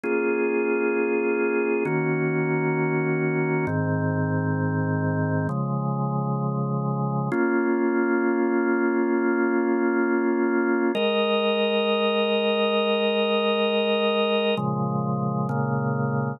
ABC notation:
X:1
M:4/4
L:1/8
Q:1/4=132
K:Bbm
V:1 name="Drawbar Organ"
[B,DFA]8 | [E,B,DG]8 | [A,,E,C]8 | [D,F,A,]8 |
[B,DF]8- | [B,DF]8 | [A,Be]8- | [A,Be]8 |
[B,,D,F,A,]4 [B,,D,A,B,]4 |]